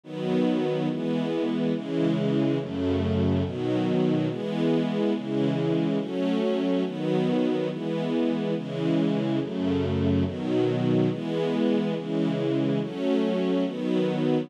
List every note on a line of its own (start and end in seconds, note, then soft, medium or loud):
0.03 0.88 D#3 medium
0.03 0.88 F#3 medium
0.03 0.88 B3 medium
0.89 1.73 E3 medium
0.89 1.73 G#3 medium
0.89 1.73 B3 medium
1.74 2.58 C#3 medium
1.74 2.58 E3 medium
1.74 2.58 G#3 medium
2.59 3.43 F#2 medium
2.59 3.43 C#3 medium
2.59 3.43 A3 medium
3.44 4.28 B2 medium
3.44 4.28 D#3 medium
3.44 4.28 F#3 medium
4.29 5.13 E3 medium
4.29 5.13 G#3 medium
4.29 5.13 B3 medium
5.14 5.98 C#3 medium
5.14 5.98 E3 medium
5.14 5.98 G#3 medium
5.99 6.83 F#3 medium
5.99 6.83 A3 medium
5.99 6.83 C#4 loud
6.84 7.69 D#3 medium
6.84 7.69 F#3 medium
6.84 7.69 B3 medium
7.70 8.54 E3 medium
7.70 8.54 G#3 medium
7.70 8.54 B3 medium
8.55 9.39 C#3 medium
8.55 9.39 E3 medium
8.55 9.39 G#3 medium
9.40 10.24 F#2 medium
9.40 10.24 C#3 medium
9.40 10.24 A3 medium
10.25 11.09 B2 medium
10.25 11.09 D#3 medium
10.25 11.09 F#3 medium
11.10 11.94 E3 medium
11.10 11.94 G#3 medium
11.10 11.94 B3 medium
11.95 12.79 C#3 medium
11.95 12.79 E3 medium
11.95 12.79 G#3 medium
12.80 13.64 F#3 medium
12.80 13.64 A3 medium
12.80 13.64 C#4 loud
13.65 14.49 D#3 medium
13.65 14.49 F#3 medium
13.65 14.49 B3 medium